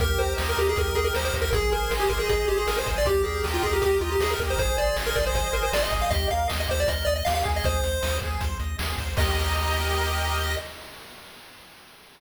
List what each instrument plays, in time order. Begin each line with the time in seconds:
0.00 synth bass 1 D#2, lead 1 (square) G4 A#4, kick, closed hi-hat
0.18 synth bass 1 D#2, lead 1 (square) A#4 C5, closed hi-hat
0.36 synth bass 1 D#2, lead 1 (square) D#5, snare
0.49 lead 1 (square) A#4
0.57 synth bass 1 D#2, lead 1 (square) G4, closed hi-hat
0.69 lead 1 (square) G#4
0.76 synth bass 1 D#2, lead 1 (square) A#4, kick, closed hi-hat
0.95 synth bass 1 D#2, lead 1 (square) G#4 D#5, closed hi-hat
1.04 lead 1 (square) A#4
1.14 synth bass 1 D#2, lead 1 (square) G4 C5, snare
1.25 lead 1 (square) C5
1.34 synth bass 1 D#2, lead 1 (square) A#4, kick, open hi-hat
1.42 lead 1 (square) A#4
1.52 synth bass 1 G#1, lead 1 (square) G#4, kick, closed hi-hat
1.71 synth bass 1 G#1, lead 1 (square) A#4 C5, closed hi-hat
1.90 synth bass 1 G#1, lead 1 (square) D#5, snare
2.00 lead 1 (square) G4
2.09 synth bass 1 G#1, lead 1 (square) G#4 A#4, kick, closed hi-hat
2.19 lead 1 (square) G#4
2.29 synth bass 1 G#1, lead 1 (square) G#4 C5, kick, closed hi-hat
2.48 synth bass 1 G#1, lead 1 (square) G4 D#5, closed hi-hat
2.58 lead 1 (square) G#4
2.67 synth bass 1 G#1, lead 1 (square) G#4 A#4, snare
2.78 lead 1 (square) C5
2.87 synth bass 1 G#1, lead 1 (square) C5, kick, closed hi-hat
2.98 lead 1 (square) D5
3.05 synth bass 1 D#2, lead 1 (square) G4, kick, closed hi-hat
3.23 synth bass 1 D#2, lead 1 (square) G#4 A#4, closed hi-hat
3.44 synth bass 1 D#2, lead 1 (square) D#5, snare
3.54 lead 1 (square) F4
3.63 synth bass 1 D#2, lead 1 (square) G4 G#4, kick, closed hi-hat
3.73 lead 1 (square) G4
3.82 synth bass 1 D#2, lead 1 (square) G4 A#4, kick, closed hi-hat
4.01 synth bass 1 D#2, lead 1 (square) F4 D#5, closed hi-hat
4.12 lead 1 (square) G4
4.19 synth bass 1 D#2, lead 1 (square) G4 G#4, snare
4.30 lead 1 (square) A#4
4.39 synth bass 1 D#2, lead 1 (square) A#4, kick, closed hi-hat
4.50 lead 1 (square) C5
4.57 synth bass 1 G#1, lead 1 (square) G#4 C5, kick, closed hi-hat
4.78 synth bass 1 G#1, lead 1 (square) C5 D5, closed hi-hat
4.96 synth bass 1 G#1, lead 1 (square) D#5, snare
5.06 lead 1 (square) A#4
5.16 synth bass 1 G#1, lead 1 (square) G#4 D5, kick, closed hi-hat
5.26 lead 1 (square) C5
5.33 synth bass 1 G#1, lead 1 (square) C5, kick, closed hi-hat
5.53 synth bass 1 G#1, lead 1 (square) A#4 D#5, closed hi-hat
5.63 lead 1 (square) C5
5.72 synth bass 1 G#1, lead 1 (square) G#4 D5, snare
5.83 lead 1 (square) D#5
5.91 synth bass 1 G#1, lead 1 (square) C5, kick, closed hi-hat
6.02 lead 1 (square) F5
6.11 synth bass 1 D#2, lead 1 (square) G4 D#5, kick, closed hi-hat
6.30 synth bass 1 D#2, lead 1 (square) A#4 F5, closed hi-hat
6.48 synth bass 1 D#2, lead 1 (square) D#5, snare
6.60 lead 1 (square) D#5
6.68 synth bass 1 D#2, lead 1 (square) G4 C5, kick, closed hi-hat
6.80 lead 1 (square) D5
6.86 synth bass 1 D#2, lead 1 (square) A#4 D#5, kick, closed hi-hat
7.05 synth bass 1 D#2, lead 1 (square) D5 D#5, closed hi-hat
7.16 lead 1 (square) D#5
7.25 synth bass 1 D#2, lead 1 (square) G4 F5, snare
7.35 lead 1 (square) F5
7.45 synth bass 1 D#2, lead 1 (square) G#4, kick, closed hi-hat
7.56 lead 1 (square) D#5
7.64 synth bass 1 D#2, lead 1 (square) C5, kick, closed hi-hat
7.83 synth bass 1 D#2, lead 1 (square) C5, closed hi-hat
8.02 synth bass 1 D#2, lead 1 (square) D#5, snare
8.22 synth bass 1 D#2, lead 1 (square) G#4, kick, closed hi-hat
8.40 synth bass 1 D#2, lead 1 (square) C5, kick, closed hi-hat
8.60 synth bass 1 D#2, lead 1 (square) D#5, closed hi-hat
8.78 synth bass 1 D#2, lead 1 (square) G#4, snare
8.98 synth bass 1 D#2, lead 1 (square) C5, kick, closed hi-hat
9.16 synth bass 1 D#2, lead 1 (square) G4 A#4 D#5, kick, crash